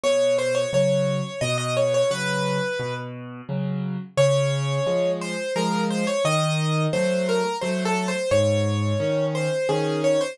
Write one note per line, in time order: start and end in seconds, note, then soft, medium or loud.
0.04 0.66 B2 medium
0.04 0.36 C#5 loud
0.39 0.55 C5 loud
0.55 0.71 C#5 medium
0.73 1.21 C#3 medium
0.73 1.21 F#3 medium
0.73 1.40 C#5 loud
1.41 2.04 B2 loud
1.41 1.57 D#5 loud
1.58 1.74 D#5 loud
1.77 1.93 C#5 medium
1.94 2.11 C#5 loud
2.11 2.59 C#3 medium
2.11 2.59 F#3 medium
2.11 2.94 B4 loud
2.79 3.42 B2 medium
3.49 3.97 C#3 medium
3.49 3.97 F#3 medium
4.17 4.79 C#3 loud
4.17 5.11 C#5 loud
4.86 5.35 F3 medium
4.86 5.35 G#3 medium
5.21 5.54 C5 loud
5.56 6.04 F3 medium
5.56 6.04 G#3 medium
5.56 5.84 A#4 loud
5.91 6.07 C5 loud
6.07 6.24 C#5 loud
6.25 6.87 D#3 loud
6.25 6.83 D#5 loud
6.93 7.42 F#3 medium
6.93 7.42 A3 medium
6.93 7.27 C5 loud
7.29 7.57 A#4 loud
7.61 8.11 F#3 medium
7.61 8.11 A3 medium
7.61 7.83 C5 medium
7.85 8.07 A4 loud
8.08 8.30 C5 loud
8.31 8.93 G#2 medium
8.31 9.26 C#5 loud
9.00 9.48 D#3 medium
9.00 9.48 C#4 medium
9.35 9.68 C5 medium
9.69 10.18 D#3 medium
9.69 10.18 C#4 medium
9.69 10.01 G#4 medium
10.04 10.20 C#5 medium
10.21 10.37 C5 loud